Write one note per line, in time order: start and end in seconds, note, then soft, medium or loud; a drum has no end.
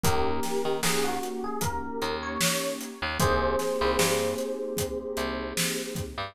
0.03 0.40 D#2 loud
0.03 2.89 A#3 medium
0.03 2.89 C#4 medium
0.03 2.89 D#4 medium
0.03 0.75 G4 medium
0.03 2.89 G4 medium
0.03 0.75 A#4 medium
0.03 kick medium
0.03 closed hi-hat medium
0.43 snare medium
0.43 closed hi-hat medium
0.65 0.81 D#3 medium
0.83 1.19 D#2 medium
0.83 1.04 G#4 medium
0.83 snare medium
1.04 1.42 F#4 medium
1.23 closed hi-hat medium
1.44 1.61 G#4 medium
1.61 2.12 A#4 medium
1.61 kick medium
1.61 closed hi-hat medium
2.02 2.38 D#2 medium
2.02 closed hi-hat soft
2.23 2.73 C#5 medium
2.41 snare loud
2.81 closed hi-hat medium
3.02 3.18 D#2 loud
3.19 3.56 C2 loud
3.19 6.04 A#3 medium
3.19 6.04 C4 medium
3.19 6.04 D#4 medium
3.19 6.04 G4 medium
3.19 6.02 G#4 loud
3.19 6.02 C5 loud
3.19 kick medium
3.19 closed hi-hat medium
3.59 snare soft
3.59 closed hi-hat medium
3.81 3.97 C2 loud
3.99 4.35 G2 loud
3.99 snare medium
4.38 closed hi-hat medium
4.77 kick medium
4.77 closed hi-hat medium
5.17 5.53 C2 medium
5.17 closed hi-hat medium
5.57 snare medium
5.95 kick medium
5.95 closed hi-hat medium
6.18 6.34 G2 medium